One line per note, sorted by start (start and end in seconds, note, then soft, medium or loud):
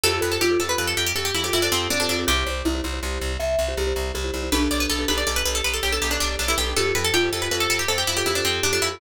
0.04 0.19 F2 loud
0.04 0.11 F4 loud
0.04 0.11 G4 loud
0.04 0.21 G4 medium
0.04 0.11 A4 loud
0.04 0.20 A4 loud
0.04 0.11 C5 loud
0.13 0.43 F4 medium
0.13 0.43 G4 medium
0.13 0.43 A4 loud
0.13 0.43 C5 loud
0.21 0.38 F2 loud
0.21 0.37 A4 medium
0.21 0.31 B4 medium
0.32 0.40 A4 medium
0.41 0.57 F2 medium
0.41 0.59 F4 medium
0.41 0.58 G4 medium
0.50 0.58 F4 loud
0.50 0.58 G4 medium
0.50 0.58 A4 loud
0.50 0.58 C5 medium
0.60 0.75 F2 medium
0.60 0.67 F4 medium
0.60 0.67 G4 loud
0.60 0.67 A4 loud
0.60 0.69 A4 medium
0.60 0.67 C5 loud
0.69 0.76 F4 medium
0.69 0.76 G4 medium
0.69 0.76 A4 medium
0.69 0.78 B4 medium
0.69 0.76 C5 loud
0.78 0.94 F2 loud
0.78 1.08 F4 medium
0.78 1.08 G4 medium
0.78 1.08 A4 medium
0.78 0.87 B4 medium
0.78 1.08 C5 medium
0.87 0.96 A4 medium
0.97 1.13 F2 medium
0.97 1.06 G4 medium
1.06 1.15 G4 medium
1.15 1.31 F2 medium
1.15 1.49 G4 medium
1.15 1.25 A4 medium
1.25 1.34 G4 medium
1.34 1.50 F2 medium
1.34 1.43 E4 medium
1.44 1.59 F4 medium
1.44 1.59 G4 loud
1.44 1.53 G4 medium
1.44 1.59 A4 medium
1.44 1.59 C5 loud
1.53 1.69 F2 loud
1.53 1.62 E4 medium
1.53 1.88 F4 medium
1.62 1.71 D4 medium
1.62 1.92 F4 medium
1.62 1.92 G4 medium
1.62 1.92 A4 loud
1.62 1.92 C5 medium
1.72 1.88 F2 loud
1.72 1.88 C4 medium
1.90 2.06 F2 medium
1.90 2.26 C4 medium
1.90 1.99 D4 medium
2.00 2.09 D4 medium
2.00 2.07 F4 medium
2.00 2.07 G4 medium
2.00 2.07 A4 medium
2.00 2.07 C5 medium
2.09 2.25 F2 medium
2.09 2.24 D4 medium
2.09 2.17 F4 loud
2.09 2.17 G4 medium
2.09 2.17 A4 medium
2.09 2.17 C5 medium
2.18 2.26 F4 medium
2.18 2.26 G4 medium
2.18 2.26 A4 medium
2.18 2.26 C5 loud
2.27 2.44 C2 loud
2.27 2.35 E4 loud
2.27 2.45 G4 medium
2.27 2.35 G4 loud
2.27 3.44 G4 medium
2.27 2.35 C5 loud
2.37 2.67 E4 medium
2.37 2.67 G4 medium
2.37 2.67 C5 medium
2.46 2.62 C2 medium
2.46 2.61 C5 medium
2.65 2.81 C2 loud
2.65 2.83 E4 medium
2.75 2.82 E4 loud
2.75 2.82 G4 medium
2.75 2.82 C5 loud
2.84 3.00 C2 medium
2.84 2.91 E4 medium
2.84 2.91 G4 medium
2.84 2.91 C5 medium
2.93 3.01 E4 medium
2.93 3.01 G4 loud
2.93 3.01 C5 loud
3.02 3.19 C2 loud
3.02 3.32 E4 medium
3.02 3.32 G4 loud
3.02 3.32 C5 medium
3.21 3.37 C2 loud
3.39 3.56 C2 medium
3.39 3.74 E5 medium
3.59 3.74 C2 medium
3.68 3.83 E4 loud
3.68 3.83 G4 loud
3.68 3.83 C5 loud
3.77 3.93 C2 loud
3.77 4.09 G4 medium
3.87 4.17 E4 medium
3.87 4.17 G4 medium
3.87 4.17 C5 medium
3.96 4.12 C2 loud
4.14 4.31 C2 loud
4.14 4.49 G4 medium
4.24 4.32 E4 loud
4.24 4.32 G4 medium
4.24 4.32 C5 loud
4.33 4.49 C2 medium
4.33 4.41 E4 medium
4.33 4.41 G4 loud
4.33 4.41 C5 medium
4.43 4.50 E4 loud
4.43 4.50 G4 medium
4.43 4.50 C5 loud
4.52 4.68 B1 loud
4.52 4.60 D4 loud
4.52 5.07 D4 medium
4.52 4.60 G4 loud
4.52 4.60 A4 loud
4.52 4.60 B4 loud
4.52 4.68 B4 medium
4.61 4.91 D4 loud
4.61 4.91 G4 loud
4.61 4.91 A4 loud
4.61 4.91 B4 medium
4.71 4.87 B1 loud
4.71 4.80 D5 medium
4.80 4.89 B4 medium
4.89 5.05 B1 loud
4.89 5.07 A4 medium
4.99 5.06 D4 loud
4.99 5.06 G4 loud
4.99 5.06 A4 loud
4.99 5.06 B4 medium
5.08 5.24 B1 loud
5.08 5.16 D4 medium
5.08 5.86 G4 medium
5.08 5.16 G4 medium
5.08 5.16 A4 loud
5.08 5.16 B4 loud
5.08 5.17 B4 medium
5.18 5.25 D4 medium
5.18 5.25 G4 loud
5.18 5.25 A4 loud
5.18 5.25 B4 medium
5.18 5.26 D5 medium
5.27 5.43 B1 medium
5.27 5.57 D4 medium
5.27 5.57 G4 medium
5.27 5.57 A4 loud
5.27 5.57 B4 loud
5.27 5.36 D5 medium
5.36 5.45 B4 medium
5.45 5.62 B1 medium
5.45 5.54 B4 medium
5.55 5.64 A4 medium
5.64 5.80 B1 medium
5.64 5.73 B4 medium
5.74 5.82 A4 medium
5.83 5.99 B1 medium
5.83 5.92 G4 medium
5.92 6.07 D4 medium
5.92 6.07 G4 medium
5.92 6.07 A4 loud
5.92 6.01 A4 medium
5.92 6.07 B4 loud
6.02 6.18 B1 medium
6.02 6.11 G4 medium
6.11 6.20 D4 medium
6.11 6.41 D4 loud
6.11 6.41 G4 loud
6.11 6.41 A4 medium
6.11 6.41 B4 medium
6.20 6.36 B1 medium
6.20 6.35 D4 medium
6.39 6.55 B1 loud
6.39 6.48 D4 medium
6.48 6.56 D4 loud
6.48 6.57 E4 medium
6.48 6.56 G4 loud
6.48 6.56 A4 medium
6.48 6.56 B4 loud
6.58 6.74 B1 loud
6.58 6.65 D4 loud
6.58 6.65 G4 medium
6.58 6.75 G4 medium
6.58 6.65 A4 medium
6.58 6.65 B4 medium
6.67 6.74 D4 medium
6.67 6.74 G4 medium
6.67 6.74 A4 medium
6.67 6.74 B4 medium
6.76 6.92 F2 loud
6.76 6.84 F4 loud
6.76 6.84 G4 loud
6.76 6.92 G4 medium
6.76 6.84 A4 loud
6.76 6.93 A4 medium
6.76 6.84 C5 loud
6.86 7.16 F4 medium
6.86 7.16 G4 medium
6.86 7.16 A4 loud
6.86 7.16 C5 medium
6.95 7.11 F2 medium
6.95 7.12 A4 medium
6.95 7.04 B4 medium
7.04 7.13 A4 medium
7.14 7.30 F2 loud
7.14 7.30 F4 medium
7.14 7.29 G4 medium
7.23 7.31 F4 medium
7.23 7.31 G4 medium
7.23 7.31 A4 loud
7.23 7.31 C5 medium
7.32 7.48 F2 loud
7.32 7.40 F4 medium
7.32 7.40 G4 medium
7.32 7.40 A4 medium
7.32 7.42 A4 medium
7.32 7.40 C5 medium
7.42 7.49 F4 loud
7.42 7.49 G4 medium
7.42 7.49 A4 medium
7.42 7.51 B4 medium
7.42 7.49 C5 medium
7.51 7.67 F2 loud
7.51 7.81 F4 medium
7.51 7.81 G4 medium
7.51 7.81 A4 loud
7.51 7.60 B4 medium
7.51 7.81 C5 medium
7.60 7.69 A4 medium
7.70 7.86 F2 medium
7.70 7.79 A4 medium
7.79 7.88 G4 medium
7.88 8.04 F2 loud
7.88 7.97 A4 medium
7.88 8.20 C5 medium
7.98 8.07 G4 medium
8.07 8.23 F2 medium
8.07 8.16 E4 medium
8.17 8.31 F4 medium
8.17 8.31 G4 loud
8.17 8.25 G4 medium
8.17 8.31 A4 loud
8.17 8.31 C5 medium
8.26 8.42 F2 medium
8.26 8.35 E4 medium
8.26 8.63 G4 medium
8.35 8.44 D4 medium
8.35 8.65 F4 medium
8.35 8.65 G4 loud
8.35 8.65 A4 medium
8.35 8.65 C5 loud
8.44 8.60 F2 medium
8.44 8.62 C4 medium
8.63 8.79 F2 medium
8.63 8.72 D4 medium
8.63 8.95 G4 medium
8.73 8.82 D4 medium
8.73 8.80 F4 medium
8.73 8.80 G4 loud
8.73 8.80 A4 loud
8.73 8.80 C5 medium
8.82 8.98 F2 loud
8.82 9.00 E4 medium
8.82 8.89 F4 medium
8.82 8.89 G4 medium
8.82 8.89 A4 medium
8.82 8.89 C5 medium
8.91 8.99 F4 medium
8.91 8.99 G4 medium
8.91 8.99 A4 loud
8.91 8.99 C5 medium